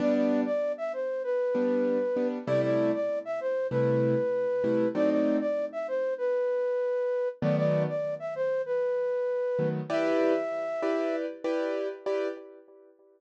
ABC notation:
X:1
M:4/4
L:1/16
Q:1/4=97
K:Em
V:1 name="Flute"
d d2 d2 e c2 B8 | d d2 d2 e c2 B8 | d d2 d2 e c2 B8 | d d2 d2 e c2 B8 |
e10 z6 |]
V:2 name="Acoustic Grand Piano"
[G,B,D]10 [G,B,D]4 [G,B,D]2 | [C,G,A,E]8 [C,G,A,E]6 [C,G,A,E]2 | [F,A,C_E]16 | [^D,F,A,B,]14 [D,F,A,B,]2 |
[EGBd]6 [EGBd]4 [EGBd]4 [EGBd]2 |]